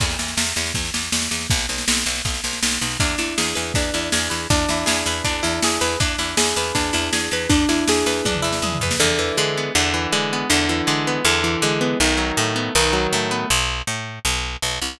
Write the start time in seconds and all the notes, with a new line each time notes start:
0.00 E2, kick, snare, crash
0.10 snare
0.19 E2, snare
0.28 snare
0.37 E2, snare
0.47 snare
0.56 E2, snare
0.66 snare
0.74 E2, kick, snare
0.85 snare
0.94 E2, snare
1.03 snare
1.12 E2, snare
1.22 snare
1.31 E2, snare
1.41 snare
1.50 B1, kick, snare
1.59 snare
1.69 B1, snare
1.78 snare
1.88 B1, snare
1.97 snare
2.06 B1, snare
2.15 snare
2.25 B1, kick, snare
2.34 snare
2.44 B1, snare
2.53 snare
2.63 B1, snare
2.72 snare
2.81 B1, snare
2.91 snare
3.00 E2 D4, kick, snare
3.18 E2 E4, snare
3.38 E2 G#4, snare
3.55 E2 B4, snare
3.74 E2 D4, kick, snare
3.94 E2 E4, snare
4.12 E2 G#4, snare
4.30 E2 B4, snare
4.50 E2 D4, kick, snare
4.69 E2 E4, snare
4.86 E2 G#4, snare
5.06 E2 B4, snare
5.24 E2 D4, kick, snare
5.43 E2 E4, snare
5.62 E2 G#4, snare
5.81 E2 B4, snare
6.00 E2 D4, kick, snare
6.18 E2 E4, snare
6.37 E2 G#4, snare
6.56 E2 B4, snare
6.75 E2 D4, kick, snare
6.93 E2 E4, snare
7.13 E2 G#4, snare
7.31 E2 B4, snare
7.49 E2 D4, kick, snare
7.69 E2 E4, snare
7.88 E2 G#4, snare
8.06 E2 B4, snare
8.25 E2 D4, kick, high tom
8.34 mid tom
8.42 E2 E4
8.53 snare
8.62 E2 G#4, high tom
8.72 mid tom
8.81 E2 B4, floor tom
8.91 snare
9.00 E2 D3
9.19 E3
9.37 D3 G#3
9.58 B3
9.75 E2 D3
9.94 E3
10.12 D3 G#3
10.33 B3
10.50 E2 D3
10.69 E3
10.87 D3 G#3
11.07 B3
11.25 E2 D3
11.44 E3
11.62 D3 G#3
11.81 B3
12.00 B1 D#3
12.17 F#3
12.37 A2 A3
12.56 B3
12.75 B1 D#3
12.93 F#3
13.13 A2 A3
13.31 B3
13.50 B1
13.87 A2
14.25 B1
14.62 B1
14.82 C2